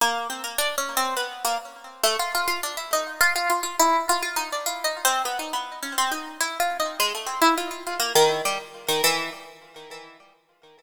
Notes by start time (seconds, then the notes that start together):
0.01 A#3
0.30 C4
0.44 A#3
0.58 D4
0.78 C#4
0.97 C4
1.17 B3
1.45 A#3
2.04 A3
2.19 F4
2.35 F4
2.48 F4
2.63 D4
2.77 E4
2.93 D#4
3.21 F4
3.36 F4
3.50 F4
3.63 F4
3.79 E4
4.09 F4
4.22 F4
4.36 D#4
4.52 D4
4.66 F4
4.84 D#4
5.05 C4
5.25 B3
5.39 D#4
5.53 B3
5.83 C#4
5.98 C4
6.12 D#4
6.41 E4
6.60 F4
6.80 D#4
7.00 G#3
7.15 A3
7.26 C4
7.42 E4
7.58 F4
7.71 F4
7.87 F4
8.00 A#3
8.15 D#3
8.45 G3
8.88 D#3
9.04 E3